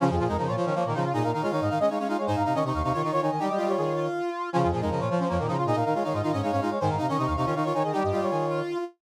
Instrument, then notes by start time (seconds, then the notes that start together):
brass section
0.00 C#3 F3 C#4 F4
0.10 F2 F4 G#4
0.18 A#2 F3 F4 G#4
0.27 F2 G#3 D#4 A#4
0.37 C#3 F3 D#4 A#4
0.47 A#2 F4 C#5
0.56 F3 F4 C#5
0.65 D#3 C#4 C#5
0.75 F3 A#3 C#5
0.84 A#2 D#3 A#3 A#4
0.94 C#3 F3 D#4 F4
1.04 F4
1.13 A#2 D#4 G#4 D#5
1.23 A#2 A#4 F5
1.32 D#3 D#4 A#4 F5
1.41 G#3 F4 C#5 F5
1.51 D#3 D#4 C#5 F5
1.60 G#2 D#5 F5
1.69 D#3 D#4 F5
1.79 G#3 C#4 D#5
1.89 G#3 D#4 C#5 F5
1.99 G#3 C#4 C#5 F5
2.08 G#3 D#4 F4 F5
2.17 G#3 C#5 F5
2.26 G#2 D#4 C5 G#5
2.36 G#2 F5 A#5
2.44 C3 D#4 F5 A#5
2.54 D#3 C#4 D#5 C#6
2.64 C3 D#4 D#5 C#6
2.74 D#2 F5 C#6
2.83 C3 D#4 F5 C#6
2.92 D#3 F4 C#5 C#6
3.01 D#3 D#4 F4 C#6
3.11 D#3 F4 C#5 C#6
3.21 D#3 D#4 C#5 G#5
3.30 D#3 D#5 G#5
3.39 G3 D#4 G4 G5
3.49 G3 D#5
3.57 G3 F4 D#5
3.68 G3 C#5
3.77 D#3 G#4
3.96 F4
4.53 C#3 F3 C#4 F4
4.62 F2 F4 G#4
4.71 A#2 F3 F4 G#4
4.81 F2 G#3 D#4 A#4
4.90 C#3 F3 A#4 D#5
4.99 A#2 F4 C#5
5.08 F3 F4 C#5
5.19 F3 C#4 C5
5.28 F2 F3 A#3 C#5
5.37 A#2 D#3 A#3 A#4
5.47 C#3 F3 D#4 F4
5.57 F4
5.65 A#2 D#4 G#4 D#5
5.74 A#2 A#4 F5
5.84 D#3 D#4 A#4 F5
5.94 G#3 F4 C#5 F5
6.03 D#3 D#4 C#5 F5
6.13 G#2 F4 D#5
6.22 D#3 D#4 F4 F5
6.32 G#2 C#4 D#5
6.42 G#3 D#4 C#5 F5
6.51 G#2 C#4 C#5 F5
6.61 G#3 D#4 F4 F5
6.70 G#3 C#5 F5
6.80 G#2 D#3 C5 G#5
6.89 G#2 F5 A#5
6.97 C3 D#4 F5 A#5
7.08 D#3 C#4 D#5 C#6
7.17 C3 D#4 D#5 C#6
7.26 D#2 F5 C#6
7.36 C3 D#4 F5 C#6
7.45 D#3 C#4 F4 C#5
7.55 D#3 D#4 F4 C#6
7.64 D#3 F4 C#5 C#6
7.73 D#3 D#4 C#5 G#5
7.82 D#3 G#4 D#5
7.92 G3 D#4 G4 G5
8.03 G2 D#5
8.11 G3 F4 D#5
8.21 G3 C#5
8.30 D#3 G#4
8.49 F4